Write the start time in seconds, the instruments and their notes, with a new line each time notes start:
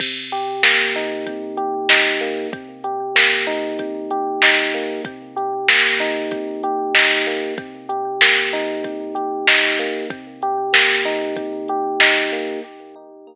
0.00 electric piano 1 C3, kick, crash
0.31 electric piano 1 G4, closed hi-hat
0.63 electric piano 1 A#3, snare
0.95 electric piano 1 D#4, closed hi-hat
1.26 electric piano 1 C3, kick, closed hi-hat
1.57 electric piano 1 G4, closed hi-hat
1.89 electric piano 1 D#4, snare
2.21 electric piano 1 A#3, closed hi-hat
2.53 electric piano 1 C3, kick, closed hi-hat
2.84 electric piano 1 G4, closed hi-hat
3.15 electric piano 1 A#3, snare
3.47 electric piano 1 D#4, closed hi-hat
3.79 electric piano 1 C3, kick, closed hi-hat
4.11 electric piano 1 G4, closed hi-hat
4.42 electric piano 1 D#4, snare
4.74 electric piano 1 A#3, closed hi-hat
5.05 electric piano 1 C3, kick, closed hi-hat
5.36 electric piano 1 G4, closed hi-hat
5.68 electric piano 1 A#3, snare
6.00 electric piano 1 D#4, closed hi-hat
6.31 electric piano 1 C3, kick, closed hi-hat
6.63 electric piano 1 G4, closed hi-hat
6.94 electric piano 1 D#4, snare
7.26 electric piano 1 A#3, closed hi-hat
7.58 electric piano 1 C3, kick, closed hi-hat
7.89 electric piano 1 G4, closed hi-hat
8.21 electric piano 1 A#3, snare
8.52 electric piano 1 D#4, snare, closed hi-hat
8.84 electric piano 1 C3, kick, closed hi-hat
9.15 electric piano 1 G4, closed hi-hat
9.47 electric piano 1 D#4, snare
9.79 electric piano 1 A#3, closed hi-hat
10.10 electric piano 1 C3, kick, closed hi-hat
10.42 electric piano 1 G4, closed hi-hat
10.73 electric piano 1 A#3, snare
11.05 electric piano 1 D#4, closed hi-hat
11.36 electric piano 1 C3, kick, closed hi-hat
11.68 electric piano 1 G4, closed hi-hat
12.00 electric piano 1 D#4, snare
12.32 electric piano 1 A#3, closed hi-hat